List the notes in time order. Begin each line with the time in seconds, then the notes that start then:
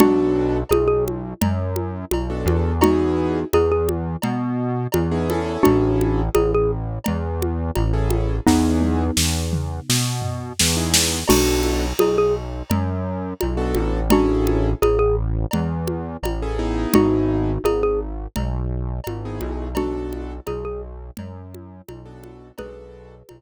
0.00 B1 B3 D4 F#4 A4, cowbell, low conga
0.69 B1 G#4, cowbell, high conga
0.88 G#4
1.08 high conga
1.41 F#2, cowbell, low conga
1.76 high conga
2.11 B1, cowbell, high conga
2.30 B3 D4 F#4 A4
2.46 E2, high conga
2.81 B3 D#4 E4 F#4 G#4, cowbell, low conga
3.53 E2 G#4, cowbell, high conga
3.72 G#4
3.89 high conga
4.22 B2, cowbell, low conga
4.92 E2, cowbell, high conga
5.11 B3 D#4 E4 G#4
5.30 C#4 E4 G#4 A4, high conga
5.63 A1 D4 F#4, cowbell, low conga
6.01 high conga
6.35 A1 G#4, cowbell, high conga
6.54 G#4
7.04 E2, cowbell, low conga
7.42 high conga
7.75 A1, cowbell, high conga
7.93 C#4 E4 G#4 A4
8.10 high conga
8.47 E2 B3 D#4 E4 G#4, kick, snare
8.81 high tom
9.17 E2, snare
9.53 mid tom
9.89 B2, snare
10.22 floor tom
10.59 E2, snare
10.77 B3 D#4 E4 G#4
10.94 snare
11.28 B1 B3 D4 F#4 A4, crash, cowbell, low conga
11.63 high conga
11.99 B1 G#4, cowbell, high conga
12.18 G#4
12.70 F#2, cowbell, low conga
13.41 B1, cowbell, high conga
13.57 B3 D4 F#4 A4
13.75 A1, high conga
14.10 C#4 D4 E4 F#4 G#4 A4, cowbell, low conga
14.47 high conga
14.82 A1 G#4, cowbell, high conga
14.99 G#4
15.51 E2, cowbell, low conga
15.87 high conga
16.23 A1, cowbell, high conga
16.42 C#4 E4 G#4 A4
16.59 B3 D#4 E4 G#4
16.94 G#1 D#4 F#4, cowbell, low conga
17.64 G#1 G#4, cowbell, high conga
17.83 G#4
18.36 B1, cowbell, low conga
19.04 G#1, cowbell, high conga
19.25 B3 D#4 E4 G#4
19.41 B1, high conga
19.75 B3 D4 F#4 A4, cowbell, low conga
20.13 high conga
20.47 B1 G#4, cowbell, high conga
20.65 G#4
21.17 F#2, cowbell, low conga
21.54 high conga
21.88 B1, cowbell, high conga
22.05 B3 D4 F#4 A4
22.24 high conga
22.58 B1 B3 D4 F#4 G#4 A4 B4, cowbell, low conga
23.29 B1, cowbell, high conga